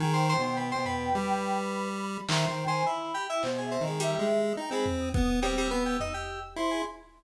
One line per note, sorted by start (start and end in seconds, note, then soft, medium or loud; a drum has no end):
0.00 0.34 D#3 loud
0.00 0.13 G#4 medium
0.00 1.54 G5 loud
0.13 0.26 C5 medium
0.29 0.42 C5 loud
0.38 0.73 B2 medium
0.43 0.56 C5 medium
0.57 0.70 B4 medium
0.72 0.84 C5 medium
0.76 1.10 B2 medium
0.85 1.88 B4 medium
0.85 floor tom medium
1.15 2.18 G3 medium
1.72 2.23 B5 medium
2.28 2.46 D#3 loud
2.28 2.46 C5 medium
2.28 2.45 E5 medium
2.28 clap loud
2.47 2.65 D#3 medium
2.47 2.64 C5 medium
2.47 2.66 G5 loud
2.66 2.83 D#3 medium
2.66 2.85 C5 loud
2.66 2.83 G#5 loud
2.85 3.12 E4 medium
2.85 2.98 B5 loud
3.00 3.26 B5 medium
3.14 3.27 G4 loud
3.29 3.42 E4 medium
3.29 3.42 G5 medium
3.43 3.78 B2 medium
3.43 3.60 C5 loud
3.43 clap medium
3.58 3.71 G#4 medium
3.64 3.81 E5 medium
3.71 3.84 C4 medium
3.80 4.15 D#3 medium
3.80 3.97 D#5 medium
3.87 4.00 G#3 soft
4.00 4.26 G3 loud
4.00 4.52 E5 medium
4.00 closed hi-hat medium
4.19 4.53 G#3 medium
4.29 cowbell medium
4.57 4.70 D#4 medium
4.57 4.72 G5 medium
4.71 4.85 G#3 medium
4.71 5.09 C4 medium
4.71 4.85 B5 loud
4.86 floor tom medium
5.00 5.51 D#6 medium
5.14 5.40 B3 medium
5.14 kick loud
5.42 5.55 G3 loud
5.42 5.68 C4 medium
5.42 cowbell loud
5.58 5.70 G3 loud
5.58 5.69 E6 medium
5.70 5.83 B3 medium
5.70 5.97 B3 medium
5.70 6.47 E6 medium
5.86 5.98 G4 medium
6.00 6.13 D#4 medium
6.00 floor tom medium
6.14 6.40 G4 medium
6.56 6.82 E4 medium
6.56 6.70 C5 soft
6.56 6.83 C6 medium
6.71 6.84 G#4 soft